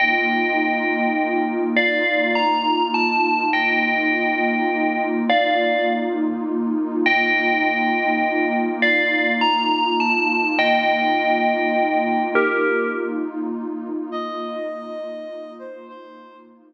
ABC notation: X:1
M:6/8
L:1/8
Q:3/8=68
K:Bblyd
V:1 name="Tubular Bells"
[_eg]6 | [df]2 b2 a2 | [_eg]6 | [df]2 z4 |
[_eg]6 | [df]2 b2 a2 | [_eg]6 | [GB]2 z4 |
z6 | z6 |]
V:2 name="Ocarina"
z6 | z6 | z6 | z6 |
z6 | z6 | z6 | z6 |
_e5 c | c2 z4 |]
V:3 name="Pad 2 (warm)"
[B,_EF]6 | [B,_EF]6 | [B,_EF]6 | [B,_EF]6 |
[B,_EF]6 | [B,_EF]6 | [B,_EF]6 | [B,_EF]6 |
[B,_EF]6 | [B,_EF]6 |]